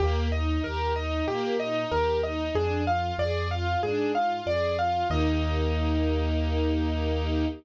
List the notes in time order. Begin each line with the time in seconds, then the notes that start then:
0.00 D#2 A#3 G4
0.32 D#4 D#5
0.63 D#2 G4 A#4
0.96 D#4 D#5
1.27 A#2 A#3 G4
1.60 D#4 D#5
1.91 D#2 G4 A#4
2.23 D#4 D#5
2.54 F2 D4 G#4
2.87 F4 F5
3.18 F2 G#4 D5
3.51 F4 F5
3.83 G#2 D4 G#4
4.14 F4 F5
4.46 F2 G#4 D5
4.79 F4 F5
5.10 D#2 A#3 D#4 G4 D#5